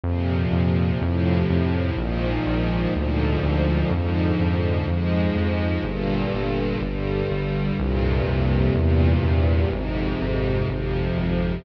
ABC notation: X:1
M:4/4
L:1/8
Q:1/4=62
K:Eb
V:1 name="String Ensemble 1" clef=bass
[B,,C,F,]2 [=A,,C,F,]2 [_A,,B,,E,F,]2 [A,,B,,D,F,]2 | [A,,D,F,]2 [A,,F,A,]2 [G,,B,,D,]2 [G,,D,G,]2 | [F,,G,,B,,C,]2 [=E,,G,,B,,C,]2 [F,,A,,C,]2 [F,,C,F,]2 |]
V:2 name="Synth Bass 1" clef=bass
F,, F,, F,, F,, B,,, B,,, D,, D,, | F,, F,, F,, F,, G,,, G,,, G,,, G,,, | C,, C,, =E,, E,, A,,, A,,, A,,, A,,, |]